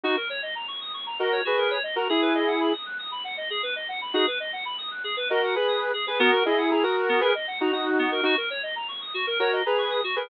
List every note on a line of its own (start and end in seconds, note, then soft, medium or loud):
0.04 0.16 D#4 loud
0.04 0.16 F#4 loud
0.04 0.15 F#4 medium
0.17 0.28 A#4 medium
0.29 0.41 C#5 medium
0.43 0.54 D#5 medium
0.55 0.67 A#5 medium
0.68 0.79 C#6 medium
0.81 0.92 D#6 medium
0.94 1.05 C#6 medium
1.06 1.18 A#5 medium
1.19 1.41 F#4 medium
1.19 1.41 A#4 loud
1.19 1.31 D#5 medium
1.32 1.44 C#5 medium
1.45 1.56 F#4 medium
1.45 1.78 G#4 medium
1.45 1.78 B4 loud
1.58 1.69 A#4 medium
1.71 1.82 C#5 medium
1.83 1.95 D#5 medium
1.96 2.08 F#4 medium
1.96 2.08 A#4 loud
1.96 2.08 A#5 medium
2.09 2.73 E4 loud
2.09 2.21 G#4 medium
2.09 2.73 G#4 loud
2.22 2.33 B4 medium
2.35 2.46 D#5 medium
2.47 2.59 F#5 medium
2.60 2.72 B5 medium
2.73 2.85 D#6 medium
2.86 2.97 F#6 medium
2.99 3.10 D#6 medium
3.11 3.23 B5 medium
3.24 3.36 F#5 medium
3.37 3.49 D#5 medium
3.50 3.62 G#4 medium
3.63 3.74 B4 medium
3.76 3.87 D#5 medium
3.88 4.00 F#5 medium
4.01 4.13 B5 medium
4.14 4.26 D#4 loud
4.14 4.26 F#4 loud
4.14 4.26 G#4 loud
4.27 4.38 B4 medium
4.40 4.51 D#5 medium
4.53 4.64 F#5 medium
4.65 4.77 B5 loud
4.78 4.90 D#6 medium
4.91 5.03 F#6 medium
5.04 5.15 G#4 medium
5.17 5.28 B4 loud
5.30 5.55 F#4 loud
5.30 5.55 A#4 loud
5.30 5.41 D#5 loud
5.43 5.54 F#5 medium
5.55 5.92 G#4 medium
5.55 5.92 B4 loud
5.55 5.67 B5 medium
5.68 5.79 D#6 loud
5.81 5.92 F#6 medium
5.94 6.05 G#4 medium
6.07 6.20 G#4 medium
6.07 6.18 B4 medium
6.07 6.20 B4 medium
6.19 6.31 B3 loud
6.19 6.44 F#4 loud
6.19 6.44 A#4 loud
6.32 6.44 A#4 loud
6.45 6.71 E4 loud
6.45 6.71 G#4 loud
6.45 6.57 D#5 medium
6.58 6.69 F#5 medium
6.71 6.83 E4 medium
6.71 6.83 G#4 loud
6.71 6.82 A#5 medium
6.83 7.21 F#4 loud
6.83 7.21 A#4 loud
6.83 6.95 D#6 medium
6.96 7.08 F#6 medium
7.09 7.20 B3 medium
7.21 7.33 G#4 loud
7.21 7.33 A#4 loud
7.21 7.33 B4 loud
7.35 7.46 D#5 medium
7.47 7.59 F#5 medium
7.60 7.72 D#4 loud
7.60 7.72 F#4 loud
7.60 7.72 A#5 medium
7.72 8.21 D#4 medium
7.72 8.21 F#4 medium
7.72 7.85 D#6 medium
7.86 7.97 F#6 medium
7.99 8.10 B3 medium
8.12 8.23 A#4 loud
8.23 8.35 D#4 loud
8.23 8.35 F#4 loud
8.23 8.36 F#4 loud
8.37 8.49 A#4 medium
8.50 8.62 C#5 medium
8.63 8.74 D#5 medium
8.76 8.87 A#5 medium
8.88 9.00 C#6 medium
9.01 9.13 D#6 medium
9.14 9.26 F#4 medium
9.27 9.38 A#4 loud
9.39 9.62 F#4 loud
9.39 9.62 A#4 loud
9.39 9.51 C#5 medium
9.53 9.64 D#5 medium
9.65 10.01 G#4 medium
9.65 10.01 B4 loud
9.65 9.77 A#5 medium
9.78 9.90 C#6 medium
9.91 10.02 D#6 medium
10.04 10.15 F#4 medium
10.16 10.28 G#4 loud
10.16 10.28 A#4 medium
10.16 10.28 B4 loud